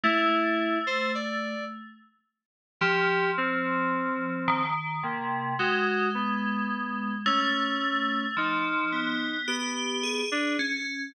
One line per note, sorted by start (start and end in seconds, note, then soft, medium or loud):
0.03 1.53 A3 medium
0.03 0.78 E4 loud
0.87 1.12 C5 medium
1.15 1.65 D5 medium
2.81 4.31 F3 soft
2.81 3.31 G4 loud
3.37 4.62 C4 loud
4.48 4.98 D#3 medium
5.03 5.53 C3 medium
5.03 5.53 A#3 soft
5.59 7.09 G#3 medium
5.59 6.09 F#4 medium
6.15 7.15 B3 medium
7.26 8.26 A3 loud
7.26 8.26 C#4 medium
8.37 8.87 F3 medium
8.37 9.37 D#4 medium
8.92 9.42 B3 medium
9.47 10.22 B3 medium
9.47 9.98 G4 medium
10.03 10.28 G#4 medium
10.31 10.56 D4 medium
10.59 11.09 C#4 medium